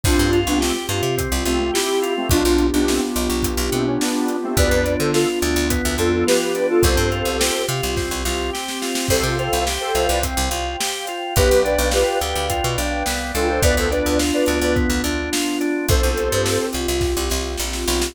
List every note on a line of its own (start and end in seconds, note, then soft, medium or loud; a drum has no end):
0.04 0.17 C2 loud
0.04 2.28 C4 medium
0.04 0.30 C4 medium
0.04 0.39 D4 medium
0.04 2.28 F4 medium
0.04 0.39 F4 loud
0.04 2.28 G4 medium
0.04 kick loud
0.04 crash medium
0.19 0.45 G2 loud
0.33 0.58 F4 medium
0.33 closed hi-hat medium
0.47 0.72 C2 loud
0.47 0.60 B3 medium
0.47 0.60 D4 medium
0.61 0.74 A3 medium
0.61 0.74 C4 medium
0.61 0.86 G4 medium
0.61 snare medium
0.89 1.02 G2 loud
0.89 1.15 F4 medium
0.89 closed hi-hat medium
1.03 1.28 C3 medium
1.17 1.43 C4 medium
1.17 kick medium
1.17 closed hi-hat medium
1.32 1.45 C2 loud
1.46 1.71 C2 medium
1.46 1.59 A3 medium
1.46 1.59 C4 medium
1.46 1.71 F4 medium
1.46 closed hi-hat medium
1.60 1.73 A3 medium
1.60 1.73 C4 medium
1.74 2.13 E4 medium
1.74 1.99 G4 medium
1.74 2.13 G4 loud
1.74 snare loud
2.02 2.28 F4 medium
2.02 closed hi-hat medium
2.17 2.30 A3 medium
2.17 2.30 C4 loud
2.29 2.43 B1 loud
2.29 4.57 B3 medium
2.29 2.67 D4 loud
2.29 4.57 D4 medium
2.29 2.67 F4 loud
2.29 4.57 F4 medium
2.29 4.57 G4 medium
2.29 kick loud
2.29 closed hi-hat medium
2.45 2.71 B1 loud
2.58 closed hi-hat medium
2.73 2.99 B1 medium
2.73 2.87 B3 medium
2.73 2.87 D4 loud
2.87 3.01 A3 medium
2.87 3.01 C4 medium
2.87 snare medium
3.16 3.29 B1 loud
3.16 closed hi-hat medium
3.30 3.55 B1 medium
3.43 kick medium
3.43 closed hi-hat loud
3.57 3.70 B1 loud
3.72 3.98 B2 medium
3.72 3.86 A3 medium
3.72 3.86 C4 medium
3.72 closed hi-hat medium
3.86 4.00 C#4 medium
4.01 4.36 B3 medium
4.01 4.36 D4 loud
4.01 snare medium
4.28 closed hi-hat medium
4.43 4.56 A3 medium
4.43 4.56 C4 loud
4.57 4.70 D2 loud
4.57 4.83 B3 medium
4.57 5.70 B3 medium
4.57 5.70 D4 medium
4.57 5.70 F4 medium
4.57 4.95 B4 medium
4.57 4.95 D5 loud
4.57 kick medium
4.57 closed hi-hat medium
4.71 4.97 F2 medium
4.85 5.11 D4 medium
4.85 closed hi-hat medium
5.00 5.25 D3 loud
5.00 5.13 A4 medium
5.00 5.13 C5 medium
5.13 5.39 F4 medium
5.13 5.27 F4 medium
5.13 5.27 A4 loud
5.13 snare medium
5.42 5.55 D2 loud
5.42 5.67 D4 medium
5.42 closed hi-hat medium
5.56 5.81 D2 loud
5.70 6.84 F3 medium
5.70 5.96 B3 medium
5.70 6.84 B3 medium
5.70 6.83 F4 medium
5.70 kick medium
5.70 closed hi-hat loud
5.85 5.98 D2 loud
5.98 6.24 F2 medium
5.98 6.24 D4 medium
5.98 6.12 F4 medium
5.98 6.12 A4 medium
5.98 closed hi-hat medium
6.13 6.26 F4 medium
6.13 6.26 A4 medium
6.27 6.53 F4 medium
6.27 6.67 G4 medium
6.27 6.67 B4 medium
6.27 snare loud
6.55 6.81 D4 medium
6.55 closed hi-hat medium
6.69 6.83 F4 medium
6.69 6.83 A4 loud
6.83 6.97 C2 loud
6.83 7.95 C4 medium
6.83 7.09 C4 medium
6.83 7.96 F4 medium
6.83 7.95 G4 medium
6.83 7.63 A4 medium
6.83 7.63 C5 loud
6.83 kick medium
6.83 closed hi-hat medium
6.97 7.23 G2 loud
7.12 7.37 F4 medium
7.12 closed hi-hat medium
7.25 7.51 C2 medium
7.40 7.66 G4 medium
7.40 snare loud
7.69 7.81 C3 loud
7.69 7.94 F4 medium
7.69 closed hi-hat medium
7.83 8.09 C2 loud
7.95 9.07 C4 loud
7.95 8.22 C4 medium
7.95 9.07 G4 medium
7.95 9.07 C5 medium
7.95 kick medium
7.95 snare medium
8.11 8.24 C2 medium
8.25 8.51 C2 loud
8.25 8.50 F4 medium
8.25 snare medium
8.53 8.79 G4 medium
8.53 snare medium
8.68 snare medium
8.82 9.07 F4 medium
8.82 snare medium
8.95 snare medium
9.08 9.23 C2 loud
9.08 9.36 C4 medium
9.08 9.23 A4 medium
9.08 9.23 C5 loud
9.08 11.35 C5 medium
9.08 11.35 F5 medium
9.08 11.35 G5 medium
9.08 kick medium
9.08 crash medium
9.23 9.49 C3 medium
9.23 9.38 F4 medium
9.23 9.38 A4 medium
9.38 9.64 F4 medium
9.38 9.64 A4 medium
9.38 9.64 C5 medium
9.38 closed hi-hat medium
9.53 9.78 C2 loud
9.66 9.92 G4 medium
9.66 snare medium
9.81 10.07 A4 medium
9.81 10.07 C5 loud
9.95 10.08 C2 medium
9.95 10.20 F4 medium
9.95 closed hi-hat medium
10.09 10.35 C2 loud
10.09 10.23 B4 medium
10.09 10.23 D5 loud
10.23 10.49 C4 medium
10.23 kick medium
10.23 closed hi-hat loud
10.37 10.50 C2 loud
10.51 10.76 C2 loud
10.51 10.77 F4 medium
10.51 closed hi-hat medium
10.80 11.05 G4 medium
10.80 snare loud
11.07 11.34 F4 medium
11.07 closed hi-hat medium
11.36 11.50 B1 loud
11.36 11.62 B3 medium
11.36 11.63 G4 loud
11.36 13.60 B4 medium
11.36 11.63 B4 loud
11.36 13.60 D5 medium
11.36 13.60 F5 medium
11.36 13.60 G5 medium
11.36 kick loud
11.36 closed hi-hat medium
11.51 11.77 B1 medium
11.65 11.90 D4 medium
11.65 11.89 B4 medium
11.65 11.89 D5 medium
11.65 closed hi-hat medium
11.78 12.04 B1 loud
11.92 12.19 F4 medium
11.92 12.18 G4 medium
11.92 12.18 B4 medium
11.92 snare medium
12.21 12.34 D2 medium
12.21 12.47 G4 medium
12.21 closed hi-hat medium
12.35 12.61 D2 medium
12.50 12.75 F4 medium
12.50 kick medium
12.50 closed hi-hat medium
12.64 12.77 B2 loud
12.78 13.03 B1 medium
12.78 13.03 D4 medium
12.78 closed hi-hat medium
13.06 13.32 C2 medium
13.06 13.31 B3 medium
13.06 snare medium
13.34 13.60 C#2 loud
13.34 13.60 D4 medium
13.34 13.48 F4 medium
13.34 13.48 A4 medium
13.34 closed hi-hat medium
13.49 13.62 A4 medium
13.49 13.62 C5 loud
13.62 13.75 D2 loud
13.62 13.88 B3 medium
13.62 15.88 B3 medium
13.62 15.88 D4 medium
13.62 15.88 F4 medium
13.62 13.76 B4 loud
13.62 13.76 D5 loud
13.62 kick medium
13.62 closed hi-hat medium
13.77 14.03 D2 loud
13.77 13.90 A4 medium
13.77 13.90 C5 loud
13.91 14.16 D4 medium
13.91 14.19 B4 medium
13.91 14.19 D5 medium
13.91 closed hi-hat medium
14.06 14.32 D2 medium
14.19 14.45 F4 medium
14.19 snare medium
14.34 14.58 B4 medium
14.34 14.58 D5 medium
14.46 14.60 D2 medium
14.46 14.73 D4 medium
14.46 closed hi-hat medium
14.61 14.87 D2 medium
14.61 14.75 B4 medium
14.61 14.75 D5 loud
14.76 15.01 B3 medium
14.76 kick medium
14.76 closed hi-hat soft
14.90 15.02 D2 loud
15.04 15.29 D2 medium
15.04 15.30 D4 medium
15.04 closed hi-hat medium
15.32 15.58 F4 medium
15.32 snare loud
15.61 15.86 D4 medium
15.61 closed hi-hat medium
15.89 16.01 C2 loud
15.89 18.14 C4 medium
15.89 18.14 F4 medium
15.89 18.14 G4 medium
15.89 16.67 A4 loud
15.89 16.67 C5 loud
15.89 kick loud
15.89 closed hi-hat medium
16.03 16.29 C2 medium
16.17 closed hi-hat medium
16.32 16.58 G2 loud
16.46 snare medium
16.73 16.87 C2 medium
16.73 closed hi-hat medium
16.88 17.14 C2 loud
17.01 kick medium
17.01 snare medium
17.17 17.29 C2 loud
17.30 17.56 C2 loud
17.30 snare medium
17.58 17.85 A#1 loud
17.58 snare medium
17.73 snare medium
17.88 18.13 B1 loud
17.88 snare medium
18.02 snare loud